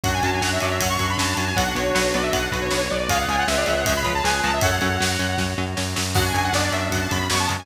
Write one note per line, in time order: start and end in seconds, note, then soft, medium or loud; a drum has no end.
0.04 0.20 F#2 loud
0.04 0.11 F#3 medium
0.04 0.11 C#4 medium
0.04 1.49 D4 medium
0.04 1.49 F#4 medium
0.04 1.55 F#4 medium
0.04 1.55 C#5 medium
0.04 0.13 F#5 loud
0.04 kick loud
0.04 ride loud
0.14 0.23 G#5 loud
0.23 0.39 F#2 medium
0.23 0.30 F#3 medium
0.23 0.30 C#4 medium
0.23 0.32 A5 medium
0.23 ride medium
0.33 0.42 G#5 medium
0.41 0.58 F#2 medium
0.41 0.49 F#3 medium
0.41 0.49 C#4 medium
0.41 0.51 F#5 medium
0.41 snare loud
0.52 0.61 E5 medium
0.60 0.79 F#2 medium
0.60 0.69 F#3 medium
0.60 0.69 C#4 medium
0.60 0.70 D5 medium
0.60 ride medium
0.71 0.80 E5 medium
0.80 0.97 F#2 medium
0.80 0.88 F#3 medium
0.80 0.88 C#4 medium
0.80 0.89 F#5 medium
0.80 kick loud
0.80 ride loud
0.89 1.08 C#6 medium
0.99 1.16 F#2 medium
0.99 1.07 F#3 medium
0.99 1.07 C#4 medium
0.99 kick loud
0.99 ride medium
1.09 1.18 B5 medium
1.17 1.34 F#2 medium
1.17 1.26 F#3 medium
1.17 1.26 C#4 medium
1.17 1.36 A5 medium
1.17 snare loud
1.37 1.53 F#2 medium
1.37 1.45 F#3 medium
1.37 1.45 C#4 medium
1.37 1.46 A5 medium
1.37 ride medium
1.47 1.56 G#5 loud
1.56 1.72 B1 loud
1.56 1.64 F#3 medium
1.56 1.64 B3 medium
1.56 2.82 D4 medium
1.56 2.82 F#4 medium
1.56 3.08 F#4 medium
1.56 3.08 B4 loud
1.56 1.74 F#5 loud
1.56 kick loud
1.56 ride loud
1.75 1.91 B1 medium
1.75 1.83 F#3 medium
1.75 1.83 B3 medium
1.75 2.10 C#5 medium
1.75 ride medium
1.95 2.12 B1 loud
1.95 2.02 F#3 medium
1.95 2.02 B3 medium
1.95 snare loud
2.14 2.30 B1 medium
2.14 2.21 F#3 medium
2.14 2.21 B3 medium
2.14 2.23 D5 medium
2.14 ride medium
2.23 2.32 E5 medium
2.32 2.48 B1 medium
2.32 2.41 F#3 medium
2.32 2.41 B3 medium
2.32 2.49 F#5 medium
2.32 kick loud
2.32 ride loud
2.52 2.68 B1 loud
2.52 2.60 F#3 medium
2.52 2.60 B3 medium
2.52 2.61 B4 medium
2.52 kick loud
2.52 ride medium
2.61 2.70 C#5 medium
2.71 2.88 B1 medium
2.71 2.79 F#3 medium
2.71 2.79 B3 medium
2.71 2.89 C#5 medium
2.71 snare loud
2.90 3.08 B1 medium
2.90 2.98 F#3 medium
2.90 2.98 B3 medium
2.90 3.08 D5 medium
3.09 3.25 C#2 loud
3.09 3.17 F3 medium
3.09 3.17 G#3 loud
3.09 3.17 C#4 medium
3.09 4.61 F4 loud
3.09 3.46 F4 medium
3.09 4.61 G#4 medium
3.09 3.46 G#4 loud
3.09 4.61 C#5 loud
3.09 3.18 F5 loud
3.09 kick loud
3.09 ride loud
3.18 3.27 F#5 medium
3.28 3.44 C#2 medium
3.28 3.36 F3 medium
3.28 3.36 G#3 medium
3.28 3.36 C#4 medium
3.28 3.38 G#5 medium
3.28 ride medium
3.38 3.47 F#5 loud
3.47 3.64 C#2 loud
3.47 3.55 F3 medium
3.47 3.55 G#3 medium
3.47 3.55 C#4 medium
3.47 4.13 G#4 medium
3.47 4.13 B4 medium
3.47 3.56 E5 medium
3.47 snare loud
3.57 3.66 D5 medium
3.66 3.84 C#2 loud
3.66 3.74 F3 medium
3.66 3.74 G#3 medium
3.66 3.74 C#4 medium
3.66 3.76 E5 medium
3.66 ride medium
3.77 3.86 F#5 medium
3.86 4.02 C#2 loud
3.86 3.94 F3 medium
3.86 3.94 G#3 medium
3.86 3.94 C#4 medium
3.86 3.95 E5 medium
3.86 kick loud
3.86 ride loud
3.96 4.12 B5 medium
4.04 4.21 C#2 medium
4.04 4.13 F3 medium
4.04 4.13 G#3 medium
4.04 4.13 C#4 medium
4.04 kick medium
4.04 ride medium
4.14 4.24 A5 medium
4.24 4.41 C#2 medium
4.24 4.32 F3 medium
4.24 4.32 G#3 medium
4.24 4.32 C#4 medium
4.24 4.55 G#4 medium
4.24 4.55 B4 medium
4.24 4.40 G#5 medium
4.24 snare loud
4.43 4.60 C#2 medium
4.43 4.51 F3 medium
4.43 4.51 G#3 medium
4.43 4.51 C#4 medium
4.43 4.52 A5 loud
4.43 ride medium
4.53 4.62 E5 medium
4.61 4.78 F#2 loud
4.61 4.70 F#3 medium
4.61 4.70 C#4 medium
4.61 6.14 F#4 medium
4.61 4.96 A4 medium
4.61 4.96 C#5 medium
4.61 6.14 C#5 medium
4.61 5.41 F#5 loud
4.61 kick loud
4.61 ride loud
4.81 4.98 F#2 loud
4.81 4.89 F#3 medium
4.81 4.89 C#4 medium
4.81 ride medium
5.00 5.17 F#2 medium
5.00 5.08 F#3 medium
5.00 5.08 C#4 medium
5.00 snare loud
5.19 5.35 F#2 loud
5.19 5.27 F#3 medium
5.19 5.27 C#4 medium
5.19 ride medium
5.38 5.54 F#2 medium
5.38 5.46 F#3 medium
5.38 5.46 C#4 medium
5.38 kick medium
5.38 snare medium
5.58 5.74 F#2 loud
5.58 5.66 F#3 medium
5.58 5.66 C#4 medium
5.77 5.94 F#2 loud
5.77 5.85 F#3 medium
5.77 5.85 C#4 medium
5.77 snare loud
5.96 6.14 F#2 loud
5.96 6.04 F#3 medium
5.96 6.04 C#4 medium
5.96 snare loud
6.15 6.32 F#2 loud
6.15 6.23 C#3 medium
6.15 6.23 F#3 medium
6.15 7.66 C#4 medium
6.15 6.50 D4 medium
6.15 6.50 F#4 medium
6.15 7.66 F#4 medium
6.15 6.24 F#5 loud
6.15 kick loud
6.15 crash loud
6.25 6.43 G#5 medium
6.34 6.50 F#2 loud
6.34 6.42 C#3 medium
6.34 6.42 F#3 medium
6.34 ride medium
6.44 6.53 F#5 loud
6.53 6.69 F#2 loud
6.53 6.61 C#3 medium
6.53 6.61 F#3 medium
6.53 7.23 B3 medium
6.53 7.23 D4 medium
6.53 6.63 D5 medium
6.53 snare loud
6.63 6.73 D5 medium
6.72 6.88 F#2 medium
6.72 6.80 C#3 medium
6.72 6.80 F#3 medium
6.72 6.88 E5 medium
6.72 ride medium
6.90 7.06 F#2 medium
6.90 6.99 C#3 medium
6.90 6.99 F#3 medium
6.90 7.00 F#5 medium
6.90 kick loud
6.90 ride loud
7.01 7.10 A5 medium
7.11 7.28 F#2 medium
7.11 7.18 C#3 medium
7.11 7.18 F#3 medium
7.11 7.27 B5 medium
7.11 kick medium
7.11 ride loud
7.30 7.46 F#2 medium
7.30 7.38 C#3 medium
7.30 7.38 F#3 medium
7.30 7.61 G#3 medium
7.30 7.61 B3 medium
7.30 7.40 C#6 medium
7.30 snare loud
7.39 7.49 A5 medium
7.49 7.66 F#2 loud
7.49 7.57 C#3 medium
7.49 7.57 F#3 medium
7.49 ride medium
7.59 7.66 G#5 medium